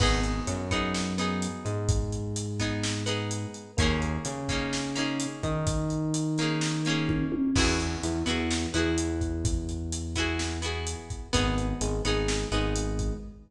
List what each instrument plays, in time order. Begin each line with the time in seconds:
0.00 synth bass 1 G#1, electric piano 1 B3, acoustic guitar (steel) B3 D#4 G#4, kick, crash
0.23 closed hi-hat
0.47 synth bass 1 F#2, electric piano 1 F#3, closed hi-hat
0.71 acoustic guitar (steel) B3 D#4 G#4, kick, closed hi-hat
0.94 snare
1.18 acoustic guitar (steel) B3 D#4 G#4, closed hi-hat
1.42 closed hi-hat
1.65 synth bass 1 G#2, electric piano 1 G#3, closed hi-hat
1.89 kick, closed hi-hat
2.12 closed hi-hat
2.36 closed hi-hat
2.59 acoustic guitar (steel) B3 D#4 G#4, kick, closed hi-hat
2.83 snare
3.06 acoustic guitar (steel) B3 D#4 G#4, closed hi-hat
3.31 closed hi-hat
3.54 closed hi-hat
3.77 synth bass 1 D#2, electric piano 1 A#3, acoustic guitar (steel) A#3 C#4 D#4, kick, closed hi-hat
3.82 acoustic guitar (steel) G#4
4.02 closed hi-hat
4.25 synth bass 1 C#3, electric piano 1 C#4, closed hi-hat
4.49 acoustic guitar (steel) A#3 C#4 D#4 G#4, kick, closed hi-hat
4.73 snare
4.95 acoustic guitar (steel) A#3 C#4 D#4 G#4, closed hi-hat
5.20 closed hi-hat
5.43 synth bass 1 D#3, electric piano 1 D#4, kick, closed hi-hat
5.67 kick, closed hi-hat
5.90 closed hi-hat
6.14 closed hi-hat
6.38 acoustic guitar (steel) A#3 C#4 D#4, closed hi-hat
6.42 acoustic guitar (steel) G#4
6.61 snare
6.85 acoustic guitar (steel) A#3 C#4 D#4, closed hi-hat
6.90 acoustic guitar (steel) G#4
7.09 kick, high tom
7.32 high tom
7.55 synth bass 1 E2, acoustic guitar (steel) B3 E4 F#4 G#4, electric piano 1 B4, kick, crash
7.80 closed hi-hat
8.03 synth bass 1 E2, electric piano 1 E3, closed hi-hat
8.26 synth bass 1 E2, electric piano 1 E3, acoustic guitar (steel) B3 E4 F#4 G#4, closed hi-hat
8.51 snare
8.74 synth bass 1 E2, electric piano 1 E3, acoustic guitar (steel) B3 E4 F#4 G#4, closed hi-hat
8.98 closed hi-hat
9.21 kick, closed hi-hat
9.45 kick, closed hi-hat
9.69 closed hi-hat
9.92 closed hi-hat
10.15 acoustic guitar (steel) B3 E4 F#4 G#4, kick, closed hi-hat
10.39 snare
10.62 acoustic guitar (steel) B3 E4 F#4 G#4, closed hi-hat
10.87 closed hi-hat
11.10 kick, closed hi-hat
11.33 synth bass 1 G#1, acoustic guitar (steel) B3 D#4 G#4, electric piano 1 B4, kick, closed hi-hat
11.58 closed hi-hat
11.81 synth bass 1 G#1, electric piano 1 G#3, closed hi-hat
12.05 synth bass 1 G#1, electric piano 1 G#3, acoustic guitar (steel) B3 D#4 G#4, closed hi-hat
12.28 snare
12.52 synth bass 1 G#1, electric piano 1 G#3, acoustic guitar (steel) B3 D#4 G#4, closed hi-hat
12.76 closed hi-hat
12.99 kick, closed hi-hat